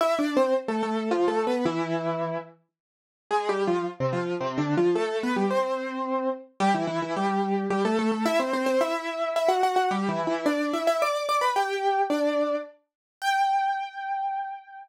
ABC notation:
X:1
M:3/4
L:1/16
Q:1/4=109
K:C
V:1 name="Acoustic Grand Piano"
(3[Ee]2 [Dd]2 [Cc]2 z [A,A] [A,A]2 (3[F,F]2 [A,A]2 [B,B]2 | [E,E]6 z6 | (3[_A,_A]2 [G,G]2 [F,F]2 z [C,C] [F,F]2 (3[C,C]2 [D,D]2 [F,F]2 | [A,A]2 [B,B] [G,G] [Cc]6 z2 |
[K:G] [G,G] [E,E] [E,E] [E,E] [G,G]4 [G,G] [A,A] [A,A] [A,A] | [Ee] [Cc] [Cc] [Cc] [Ee]4 [Ee] [Ff] [Ff] [Ff] | (3[G,G]2 [E,E]2 [E,E]2 [Dd]2 [Ee] [Ee] [dd']2 [dd'] [Bb] | [Gg]4 [Dd]4 z4 |
g12 |]